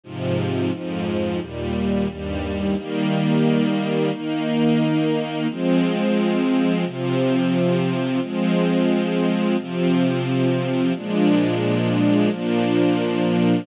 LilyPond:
\new Staff { \time 4/4 \key ees \major \tempo 4 = 88 <aes, c f>4 <f, aes, f>4 <ees, bes, g>4 <ees, g, g>4 | <ees g bes>2 <ees bes ees'>2 | <f aes c'>2 <c f c'>2 | <f aes c'>2 <c f c'>2 |
<bes, f aes d'>2 <bes, f bes d'>2 | }